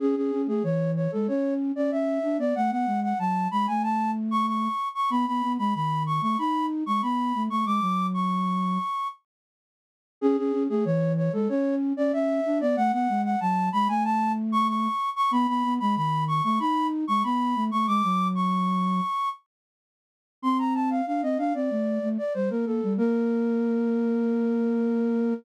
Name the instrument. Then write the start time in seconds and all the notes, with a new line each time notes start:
flute
0.00 C#4 G#4
0.16 C#4 G#4
0.32 C#4
0.47 A3 G#4
0.63 E3 C#5
0.96 C#5
1.12 G#3 A4
1.28 C#4 C#5
1.76 C#4 D5
1.91 C#4 E5
2.23 D4
2.38 B3 D5
2.55 A3 F#5
2.71 B3 F#5
2.86 G#3
3.03 F#5
3.19 F#3 A5
3.51 G#3 B5
3.67 A3 G#5
3.83 A5
4.31 C#6
4.47 C#6
4.95 C#6
5.10 B3 B5
5.27 B3 B5
5.42 B3
5.59 G#3 B5
5.74 D#3 B5
6.06 C#6
6.21 A3 C#6
6.38 D#4 B5
6.86 G#3 C#6
7.02 B3 B5
7.35 A3
7.49 A3 C#6
7.65 G#3 D6
7.81 F#3
8.14 C#6
10.21 C#4 G#4
10.37 C#4 G#4
10.52 C#4
10.69 A3 G#4
10.85 E3 C#5
11.17 C#5
11.33 G#3 A4
11.49 C#4 C#5
11.97 C#4 D5
12.13 C#4 E5
12.46 D4
12.61 B3 D5
12.76 A3 F#5
12.92 B3 F#5
13.09 G#3
13.24 F#5
13.40 F#3 A5
13.72 G#3 B5
13.88 A3 G#5
14.04 A5
14.52 C#6
14.68 C#6
15.16 C#6
15.31 B3 B5
15.48 B3 B5
15.64 B3
15.80 G#3 B5
15.96 D#3 B5
16.28 C#6
16.44 A3 C#6
16.60 D#4 B5
17.07 G#3 C#6
17.23 B3 B5
17.55 A3
17.71 A3 C#6
17.87 G#3 D6
18.03 F#3
18.35 C#6
20.42 C4 C6
20.59 A#5
20.74 A5
20.90 F5
21.06 D4 F5
21.22 C4 D#5
21.38 D4 F5
21.54 C4 D5
21.70 A3
22.02 A3
22.18 D5
22.34 G3 C5
22.50 A#3 A#4
22.66 A#3 A4
22.83 G3
22.97 A#3 A#4